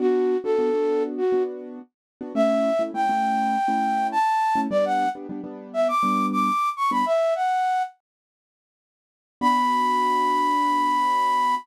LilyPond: <<
  \new Staff \with { instrumentName = "Flute" } { \time 4/4 \key b \minor \tempo 4 = 102 fis'8. a'4~ a'16 fis'8 r4. | e''4 g''2 a''4 | d''16 fis''8 r4 e''16 d'''8. d'''8. cis'''16 b''16 | e''8 fis''4 r2 r8 |
b''1 | }
  \new Staff \with { instrumentName = "Acoustic Grand Piano" } { \time 4/4 \key b \minor <b d' fis'>8. <b d' fis'>16 <b d' fis'>16 <b d' fis'>4 <b d' fis'>4. <b d' fis'>16 | <a cis' e'>8. <a cis' e'>16 <a cis' e'>16 <a cis' e'>4 <a cis' e'>4. <a cis' e'>16 | <g b d'>8. <g b d'>16 <g b d'>16 <g b d'>4 <g b d'>4. <g b d'>16 | r1 |
<b d' fis'>1 | }
>>